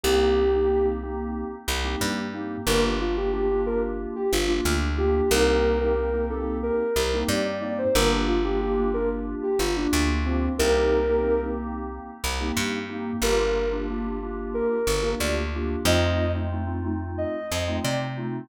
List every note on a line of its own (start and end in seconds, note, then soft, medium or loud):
0.03 1.44 C2 medium
0.03 0.43 A#3 medium
0.03 0.43 C4 medium
0.03 0.43 D#4 medium
0.03 0.43 G4 medium
0.03 0.87 G4 medium
0.53 0.66 A#3 medium
0.53 0.66 C4 medium
0.53 0.66 D#4 medium
0.53 0.66 G4 medium
0.68 0.81 A#3 medium
0.68 0.81 C4 medium
0.68 0.81 D#4 medium
0.68 0.81 G4 medium
0.85 0.98 A#3 medium
0.85 0.98 C4 medium
0.85 0.98 D#4 medium
0.85 0.98 G4 medium
1.03 1.56 A#3 medium
1.03 1.56 C4 medium
1.03 1.56 D#4 medium
1.03 1.56 G4 medium
1.68 1.96 C2 medium
1.84 2.24 A#3 medium
1.84 2.24 C4 medium
1.84 2.24 D#4 medium
1.84 2.24 G4 medium
2.01 2.57 G2 medium
2.33 2.60 A#3 medium
2.33 2.60 C4 medium
2.33 2.60 D#4 medium
2.33 2.60 G4 medium
2.67 4.07 G1 medium
2.67 3.06 A#3 medium
2.67 3.06 D4 medium
2.67 3.06 F4 medium
2.67 3.06 G4 medium
2.67 2.83 A#4 medium
3.00 3.16 F4 medium
3.17 3.30 A#3 medium
3.17 3.30 D4 medium
3.17 3.30 F4 medium
3.17 3.32 G4 medium
3.17 3.30 G4 medium
3.32 3.45 A#3 medium
3.32 3.45 D4 medium
3.32 3.45 F4 medium
3.32 3.45 G4 medium
3.32 3.61 G4 medium
3.51 3.64 A#3 medium
3.51 3.64 D4 medium
3.51 3.64 F4 medium
3.51 3.64 G4 medium
3.66 4.19 A#3 medium
3.66 4.19 D4 medium
3.66 4.19 F4 medium
3.66 4.19 G4 medium
3.66 3.82 A#4 medium
4.16 4.31 G4 medium
4.32 4.61 G1 medium
4.32 4.48 F4 medium
4.47 4.87 A#3 medium
4.47 4.87 D4 medium
4.47 4.87 F4 medium
4.47 4.75 F4 medium
4.47 4.87 G4 medium
4.65 5.21 D2 medium
4.97 5.23 A#3 medium
4.97 5.23 D4 medium
4.97 5.23 F4 medium
4.97 5.23 G4 medium
4.97 5.30 G4 medium
5.31 6.71 C2 loud
5.31 5.73 A#3 medium
5.31 5.73 C4 medium
5.31 5.73 D#4 medium
5.31 5.73 G4 medium
5.31 5.78 A#4 medium
5.80 5.94 A#3 medium
5.80 5.94 C4 medium
5.80 5.94 D#4 medium
5.80 5.94 G4 medium
5.80 6.26 A#4 medium
5.95 6.08 A#3 medium
5.95 6.08 C4 medium
5.95 6.08 D#4 medium
5.95 6.08 G4 medium
6.13 6.27 A#3 medium
6.13 6.27 C4 medium
6.13 6.27 D#4 medium
6.13 6.27 G4 medium
6.30 6.83 A#3 medium
6.30 6.83 C4 medium
6.30 6.83 D#4 medium
6.30 6.83 G4 medium
6.30 6.57 A4 medium
6.63 7.17 A#4 medium
6.96 7.24 C2 medium
7.13 7.53 A#3 medium
7.13 7.53 C4 medium
7.13 7.53 D#4 medium
7.13 7.53 G4 medium
7.28 7.84 G2 medium
7.28 7.45 D5 medium
7.45 7.61 D5 medium
7.61 7.88 A#3 medium
7.61 7.88 C4 medium
7.61 7.88 D#4 medium
7.61 7.88 G4 medium
7.61 7.77 D5 medium
7.78 7.94 C5 medium
7.95 9.35 G1 medium
7.95 8.35 A#3 medium
7.95 8.35 D4 medium
7.95 8.35 F4 medium
7.95 8.35 G4 medium
7.95 8.10 A#4 medium
8.28 8.43 F4 medium
8.44 8.57 A#3 medium
8.44 8.57 D4 medium
8.44 8.57 F4 medium
8.44 8.57 G4 medium
8.44 8.60 G4 medium
8.61 8.74 A#3 medium
8.61 8.74 D4 medium
8.61 8.74 F4 medium
8.61 8.74 G4 medium
8.61 8.91 G4 medium
8.77 8.90 A#3 medium
8.77 8.90 D4 medium
8.77 8.90 F4 medium
8.77 8.90 G4 medium
8.94 9.47 A#3 medium
8.94 9.47 D4 medium
8.94 9.47 F4 medium
8.94 9.47 G4 medium
8.94 9.09 A#4 medium
9.43 9.59 G4 medium
9.59 9.87 G1 medium
9.59 9.75 F4 medium
9.76 10.18 A#3 medium
9.76 10.03 D4 medium
9.76 10.18 D4 medium
9.76 10.18 F4 medium
9.76 10.18 G4 medium
9.93 10.49 D2 medium
10.25 10.51 A#3 medium
10.25 10.52 C4 medium
10.25 10.51 D4 medium
10.25 10.51 F4 medium
10.25 10.51 G4 medium
10.59 12.00 C2 medium
10.59 10.99 A#3 medium
10.59 10.99 C4 medium
10.59 10.99 D#4 medium
10.59 10.99 G4 medium
10.59 11.40 A#4 medium
11.09 11.22 A#3 medium
11.09 11.22 C4 medium
11.09 11.22 D#4 medium
11.09 11.22 G4 medium
11.23 11.36 A#3 medium
11.23 11.36 C4 medium
11.23 11.36 D#4 medium
11.23 11.36 G4 medium
11.43 11.56 A#3 medium
11.43 11.56 C4 medium
11.43 11.56 D#4 medium
11.43 11.56 G4 medium
11.58 12.11 A#3 medium
11.58 12.11 C4 medium
11.58 12.11 D#4 medium
11.58 12.11 G4 medium
12.24 12.52 C2 medium
12.40 12.79 A#3 medium
12.40 12.79 C4 medium
12.40 12.79 D#4 medium
12.40 12.79 G4 medium
12.57 13.13 G2 medium
12.89 13.16 A#3 medium
12.89 13.16 C4 medium
12.89 13.16 D#4 medium
12.89 13.16 G4 medium
13.22 14.62 G1 medium
13.22 13.63 A#3 medium
13.22 13.63 D4 medium
13.22 13.63 F4 medium
13.22 13.63 G4 medium
13.22 13.69 A#4 medium
13.72 13.85 A#3 medium
13.72 13.85 D4 medium
13.72 13.85 F4 medium
13.72 13.85 G4 medium
13.90 14.03 A#3 medium
13.90 14.03 D4 medium
13.90 14.03 F4 medium
13.90 14.03 G4 medium
14.04 14.17 A#3 medium
14.04 14.17 D4 medium
14.04 14.17 F4 medium
14.04 14.17 G4 medium
14.23 14.75 A#3 medium
14.23 14.75 D4 medium
14.23 14.75 F4 medium
14.23 14.75 G4 medium
14.54 15.09 A#4 medium
14.87 15.15 G1 medium
15.02 15.41 A#3 medium
15.02 15.41 D4 medium
15.02 15.41 F4 medium
15.02 15.41 G4 medium
15.20 15.76 D2 medium
15.20 15.36 D5 medium
15.55 15.81 A#3 medium
15.55 15.81 D4 medium
15.55 15.81 F4 medium
15.55 15.81 G4 medium
15.85 17.25 F2 loud
15.85 16.24 A3 medium
15.85 16.24 C4 medium
15.85 16.24 D#4 medium
15.85 16.24 F4 medium
15.85 16.31 D#5 medium
16.35 16.48 A3 medium
16.35 16.48 C4 medium
16.35 16.48 D#4 medium
16.35 16.48 F4 medium
16.52 16.65 A3 medium
16.52 16.65 C4 medium
16.52 16.65 D#4 medium
16.52 16.65 F4 medium
16.67 16.80 A3 medium
16.67 16.80 C4 medium
16.67 16.80 D#4 medium
16.67 16.80 F4 medium
16.84 17.37 A3 medium
16.84 17.37 C4 medium
16.84 17.37 D#4 medium
16.84 17.37 F4 medium
17.18 17.75 D#5 medium
17.52 17.80 F2 medium
17.68 18.07 A3 medium
17.68 18.07 C4 medium
17.68 18.07 D#4 medium
17.68 18.07 F4 medium
17.84 18.41 C3 medium
17.84 17.99 D5 medium
18.17 18.44 A3 medium
18.17 18.44 C4 medium
18.17 18.44 D#4 medium
18.17 18.44 F4 medium